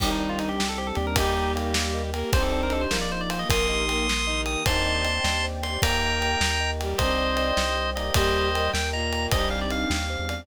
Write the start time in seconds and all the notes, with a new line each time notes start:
0.00 C2 D#3 C4 D4 D#4 G4 C5, kick, crash
0.05 D#4 G4
0.11 D#4
0.20 D#4 D5
0.29 F4
0.39 D#4 D#5, ride
0.49 G4
0.58 G3 C4 D4 G4 G5, snare
0.69 A4
0.78 G4 C5
0.87 A4
0.95 D#2 G4 D5, ride
1.07 A#4
1.15 G3 A#3 D#4 G4 A#4, kick, ride
1.22 G4
1.36 D#5
1.55 A#3 G5, ride
1.74 A#3 G4 A#4, snare
1.94 D#5
2.13 A#3 A#4 G5, ride
2.32 C2 C4 D4 D#4 G4 C5, kick, ride
2.38 D#4 G4
2.42 A4
2.52 A4 D5
2.63 A#4
2.70 A4 D#5, ride
2.81 C5
2.90 A#1 A#3 D#4 F4 A#4, snare
2.96 F4
3.01 D5
3.11 C5 D#5
3.21 D5
3.30 C5 F5, ride
3.39 D#5
3.49 A#1 A#3 D#4 G4 A#4 C6 D#6, kick, ride
3.69 D#5
3.88 A#3 A#4 G5, ride
4.07 A#3 G4 A#4, snare
4.26 D#3 D#4 D#5
4.46 G5 D#6, ride
4.66 D#2 D#3 C4 D4 D#4 C5 D5 D#5 G5 A5 C6, kick, ride
4.71 D#4 G4
4.86 D5
5.05 D#5, ride
5.24 D#2 G4 C5 D5 G5, snare
5.44 C5
5.63 D5 C6, ride
5.82 D#2 A#3 D#4 A#4 D#5 G5 A#5, kick, ride
5.87 G4
6.02 D#5
6.21 G5, ride
6.41 D#2 A#4 G5 A#5, snare
6.60 D#5
6.80 G3 G4 G5, ride
6.98 C2 C4 D4 C5 D5 D#5 G5, kick, ride
7.04 D#4 G4
7.18 D5
7.37 D#5, ride
7.56 C2 G4 C5 D5 G5, snare
7.77 C5
7.95 A#3 D#4 D5 D#5, ride
8.01 G4
8.14 D#2 G3 G4 A#4 C5 D#5 G5, kick, ride
8.35 D#5
8.54 G3 G4 G5, ride
8.73 D#2 A#4 G5 A#5, snare
8.93 A#2 A#3 D#5 A#5
9.12 G5, ride
9.31 C2 G3 C4 D4 D#4 G4 C5 D#5, kick, ride
9.37 D#4 G4
9.50 D5 F5
9.61 D5
9.70 D#5 F5, ride
9.90 D#2 G3 C4 D4 G4 F5 G5, snare
10.10 C5
10.19 E2
10.29 D5, ride